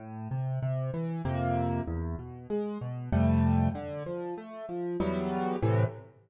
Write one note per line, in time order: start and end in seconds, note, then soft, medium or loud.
0.00 0.28 A2 medium
0.31 0.59 C3 medium
0.62 0.91 C3 medium
0.94 1.22 E3 medium
1.25 1.81 F2 medium
1.25 1.81 C3 medium
1.25 1.81 A#3 medium
1.88 2.16 E2 medium
2.19 2.47 B2 medium
2.50 2.78 G#3 medium
2.81 3.10 B2 medium
3.12 3.69 F2 medium
3.12 3.69 C3 medium
3.12 3.69 G3 medium
3.12 3.69 A3 medium
3.75 4.03 D3 medium
4.06 4.34 F3 medium
4.38 4.66 A3 medium
4.69 4.97 F3 medium
5.00 5.56 E2 medium
5.00 5.56 F#3 medium
5.00 5.56 G3 medium
5.00 5.56 B3 medium
5.62 5.84 A2 loud
5.62 5.84 C3 medium
5.62 5.84 E3 medium